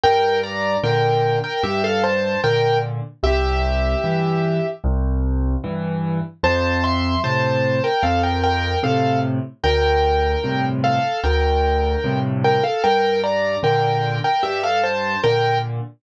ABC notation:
X:1
M:4/4
L:1/16
Q:1/4=75
K:F
V:1 name="Acoustic Grand Piano"
[Bg]2 [db]2 [Bg]3 [Bg] [Ge] [Af] [ca]2 [Bg]2 z2 | [Ge]8 z8 | [ca]2 [ec']2 [ca]3 [Bg] [Af] [Bg] [Bg]2 [Af]2 z2 | [Bg]6 [Af]2 [Bg]6 [Bg] [Af] |
[Bg]2 [db]2 [Bg]3 [Bg] [Ge] [Af] [ca]2 [Bg]2 z2 |]
V:2 name="Acoustic Grand Piano" clef=bass
G,,4 [B,,D,]4 G,,4 [B,,D,]4 | C,,4 [G,,E,]4 C,,4 [G,,E,]4 | F,,4 [A,,C,]4 F,,4 [A,,C,]4 | D,,4 [G,,A,,C,]4 D,,4 [G,,A,,C,]4 |
G,,4 [B,,D,]4 G,,4 [B,,D,]4 |]